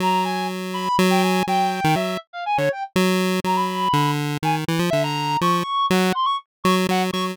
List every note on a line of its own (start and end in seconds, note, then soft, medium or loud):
0.00 0.89 F#3 medium
0.00 0.24 A#5 medium
0.24 0.47 G#5 medium
0.74 0.96 B5 loud
0.99 1.43 F#3 loud
1.10 1.22 G5 medium
1.22 1.44 G#5 medium
1.47 1.81 F#3 medium
1.47 1.93 G5 loud
1.84 1.95 D#3 loud
1.95 2.17 F#3 medium
1.95 2.18 E5 medium
2.33 2.44 F5 medium
2.46 2.57 G#5 medium
2.57 2.69 D3 medium
2.57 2.69 C#5 loud
2.72 2.83 G5 medium
2.96 3.40 F#3 loud
3.44 3.88 F#3 medium
3.44 3.56 A#5 medium
3.55 4.11 B5 medium
3.93 4.37 D3 medium
4.43 4.65 D#3 medium
4.43 4.55 G#5 medium
4.68 4.79 E3 medium
4.79 4.90 F3 medium
4.90 5.37 D3 medium
4.90 5.01 E5 loud
5.03 5.37 A#5 loud
5.41 5.63 F3 medium
5.41 5.86 C#6 medium
5.90 6.12 F#3 loud
5.90 6.13 F#5 medium
6.15 6.26 C6 medium
6.25 6.36 C#6 loud
6.64 6.87 F#3 loud
6.64 6.75 C#6 medium
6.89 7.11 F#3 medium
6.89 7.01 F#5 loud
7.13 7.36 F#3 medium
7.13 7.24 C#6 loud